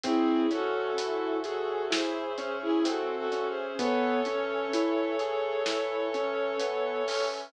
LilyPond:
<<
  \new Staff \with { instrumentName = "Violin" } { \time 4/4 \key cis \minor \tempo 4 = 64 <e' gis'>8 <fis' a'>4 <fis' a'>8 <gis' bis'>8. <e' gis'>16 \tuplet 3/2 { <fis' a'>8 <fis' a'>8 <gis' bis'>8 } | <a' cis''>1 | }
  \new Staff \with { instrumentName = "Acoustic Grand Piano" } { \time 4/4 \key cis \minor bis8 cis'8 e'8 gis'8 e'8 cis'8 bis8 cis'8 | b8 cis'8 e'8 gis'8 e'8 cis'8 b8 cis'8 | }
  \new Staff \with { instrumentName = "Synth Bass 2" } { \clef bass \time 4/4 \key cis \minor cis,1 | cis,1 | }
  \new Staff \with { instrumentName = "Brass Section" } { \time 4/4 \key cis \minor <bis' cis'' e'' gis''>1 | <b' cis'' e'' gis''>1 | }
  \new DrumStaff \with { instrumentName = "Drums" } \drummode { \time 4/4 <hh bd>8 hh8 hh8 hh8 sn8 hh8 hh8 hh8 | <hh bd>8 hh8 hh8 hh8 sn8 hh8 hh8 hho8 | }
>>